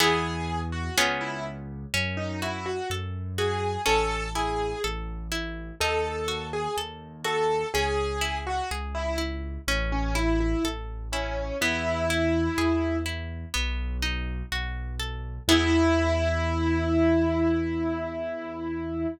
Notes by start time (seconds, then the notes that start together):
0.00 E2 B3 E4 G#4
0.72 F#4
0.97 C#2 B3 C#4 F4 G#4
1.21 E4
1.94 F#2 C#4
2.17 D#4
2.42 E4 F#4
2.66 F#4
2.90 F#2 A4
3.38 F#4 G#4
3.86 A1 C#4 A4
4.35 E4 G#4
4.84 A1 A4
5.32 E4
5.80 D#2 D#4 A4
6.28 F#4
6.53 G#4
6.77 D#2 A4
7.24 F#4 A4
7.74 C#2 C#4 G#4
8.21 E4
8.47 F#4
8.71 C#2 G#4
8.95 E4
9.18 E4
9.68 A1 C#4
9.92 C#4
10.15 E4
10.40 E4
10.64 A1 A4
11.13 C#4 E4
11.61 E2 B3 E4
12.10 E4
12.58 E2 G#4
13.06 E4
13.54 B1 B3
14.02 D#4
14.52 B1 F#4
15.00 A4
15.48 E2 B3 E4 G#4